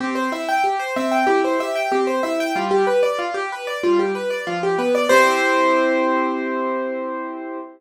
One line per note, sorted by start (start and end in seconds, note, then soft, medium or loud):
0.00 0.29 C4 loud
0.00 0.15 G4 medium
0.15 0.30 C5 medium
0.32 0.61 E4 medium
0.32 0.47 E5 medium
0.49 0.63 G5 medium
0.64 0.78 G4 medium
0.80 0.94 C5 medium
0.96 1.25 C4 loud
0.96 1.11 E5 medium
1.12 1.26 G5 medium
1.27 1.56 E4 medium
1.27 1.41 G4 medium
1.44 1.59 C5 medium
1.60 1.88 G4 medium
1.60 1.75 E5 medium
1.76 1.90 G5 medium
1.92 2.20 C4 medium
1.92 2.06 G4 medium
2.07 2.22 C5 medium
2.23 2.52 E4 medium
2.23 2.38 E5 medium
2.40 2.55 G5 medium
2.56 2.84 G3 loud
2.56 2.70 F4 medium
2.71 2.86 G4 medium
2.87 3.02 B4 medium
3.03 3.17 D5 medium
3.19 3.33 F4 medium
3.34 3.49 G4 medium
3.52 3.67 B4 medium
3.67 3.82 D5 medium
3.83 4.12 G3 medium
3.83 3.98 F4 medium
3.99 4.14 G4 medium
4.15 4.30 B4 medium
4.30 4.45 D5 medium
4.47 4.76 F3 medium
4.47 4.62 F4 medium
4.63 4.78 G4 medium
4.78 5.07 B3 medium
4.78 4.93 B4 medium
4.95 5.09 D5 medium
5.09 7.59 C4 loud
5.09 7.59 E4 loud
5.09 7.59 G4 loud
5.09 7.58 C5 loud